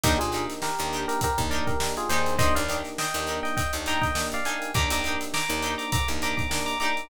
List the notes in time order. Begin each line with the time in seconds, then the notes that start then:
0.03 D#2 A#3 D4 D#4 G4 A#4, kick, closed hi-hat
0.19 A#2 F4 G#4, closed hi-hat
0.32 A#3 D4 D#4 G4 A#4, closed hi-hat
0.50 snare, closed hi-hat
0.62 G4 A#4, snare
0.79 D#2 A#3 D4 D#4 G4, closed hi-hat
0.92 D4 D#4 G4 A#4, snare, closed hi-hat
1.08 G4 A#4, closed hi-hat
1.21 G4 A#4, kick, closed hi-hat
1.38 D#2 A#3 D4 D#4 G4, kick, closed hi-hat
1.51 D4 D#4 G4 A#4 D5, closed hi-hat
1.67 G4 A#4, kick, closed hi-hat
1.80 A#3 D4 D#4 G4, snare
1.97 F4 G#4, closed hi-hat
2.09 D#2 A#3 D4 D#4 G4 G#4 A#4 C5, closed hi-hat
2.26 closed hi-hat
2.38 A#3 D4 D#4 G4 A#4 C5 D#5, kick, closed hi-hat
2.55 D#2 D5 F5, closed hi-hat
2.68 A#3 D4 D#4 G4 A#4, closed hi-hat
2.84 snare, closed hi-hat
2.98 D#5 G5, snare
3.14 D#2 A#3 D4 D#4 G4, closed hi-hat
3.27 D4 D#4 G4 A#4, closed hi-hat
3.43 D#5 G5, snare, closed hi-hat
3.57 D#5 G5, kick, closed hi-hat
3.73 D#2 A#3 D4 D#4 G4, closed hi-hat
3.86 D4 D#4 G4 A#4 G5 A#5, closed hi-hat
4.01 D#5 G5, kick, snare, closed hi-hat
4.15 A#3 D4 D#4 G4, snare
4.32 D5 F5, closed hi-hat
4.45 A#3 D4 D#4 G4 A#4 F5 G#5, closed hi-hat
4.62 closed hi-hat
4.74 D#2 A#3 D4 D#4 G4 A#4 A#5 D6, kick
4.90 D#2 A#5 D6, closed hi-hat
5.04 A#3 D4 D#4 G4 A#4, closed hi-hat
5.21 snare, closed hi-hat
5.34 A#5 D6, snare
5.49 D#2 A#3 D4 D#4 G4, closed hi-hat
5.62 D4 D#4 G4 A#4, closed hi-hat
5.78 A#5 D6, closed hi-hat
5.92 A#5 D6, kick, closed hi-hat
6.08 D#2 A#3 D4 D#4 G4, closed hi-hat
6.22 D4 D#4 G4 A#4 A#5 D6, closed hi-hat
6.37 A#5 D6, kick, closed hi-hat
6.50 A#3 D4 D#4 G4, snare
6.66 A#5 D6, closed hi-hat
6.80 A#3 D4 D#4 G4 A#4 A#5 D6, snare, closed hi-hat
6.97 snare, closed hi-hat